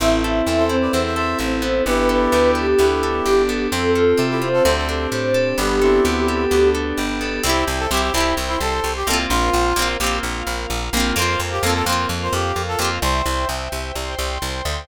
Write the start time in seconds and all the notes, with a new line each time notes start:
0.00 A1 C4 E4 A4
0.22 E4 A4
0.46 E2 C4 A4
0.57 A4 C5
0.69 C4 E4
0.81 B4 D5
0.92 E2 C4 E4 C5 E5
1.06 C5 E5
1.16 A4 C5 E5
1.39 A1 C4 E4
1.62 B3 E4
1.86 G1 B3 D4 E4 G4 A4 B4
2.09 D4 A4 B4
2.32 D2 B3 G4
2.55 G4 A4
2.77 D2 B3 E4 G4
3.03 D4 A4
3.25 G1 G4
3.49 B3 A4
3.71 F2 C4 F4 A4
3.95 F4 A4
4.18 C3 C4 A4
4.30 E4 G4
4.42 C4 F4 C5
4.53 F4 A4
4.63 D2 C4 D4 G4 A4 C5
4.77 A4 C5
4.89 D4 A4 C5
5.12 A2 G4 C5
5.34 A4
5.58 G1 G3 B3 D4 G4 A4
5.81 C4 D4 E4 A4
6.04 D2 B3 G4
6.28 G4 A4
6.51 D2 B3
6.74 D4 A4
6.97 G1 G4
7.21 B3 A4
7.44 C2 C4 E4 C5 E5 G5
7.49 G4
7.67 C2
7.79 A4
7.91 C2 C4 E4 G4
7.97 G4
8.02 G4
8.12 C2 C4 E4
8.17 E4 G4
8.37 C2 C5 G5 C6
8.48 E4
8.60 C2 A4
8.84 C2
8.96 G4
9.07 C2 A#3 C4 A4
9.13 F4
9.30 A#1 F4 A#4 C5 F5
9.53 A#1
9.76 A#1 A#3 C4
9.82 F4
10.00 A#1 A#3 G4
10.04 C4 F4
10.23 A#1 F4 A#4 F5
10.47 A#1
10.70 A#1
10.93 A#1 A#3 C4
11.00 F4
11.16 F2 A#3 C4 A#4 C5 F5
11.22 F4
11.40 F2
11.51 G4
11.63 F2 A#3 C4 A4
11.69 F4
11.74 A4
11.86 F2 A#3 C4 C5
11.92 F4
12.09 F2 F4 A#4 F5
12.23 C5
12.33 F2 G4
12.56 F2
12.68 A4
12.79 F2 A#3 C4 G4
12.84 F4
13.02 C2 C5 E5 G5
13.26 C2
13.49 C2
13.72 C2
13.95 C2 C5 G5 C6
14.19 C2
14.42 C2
14.65 D2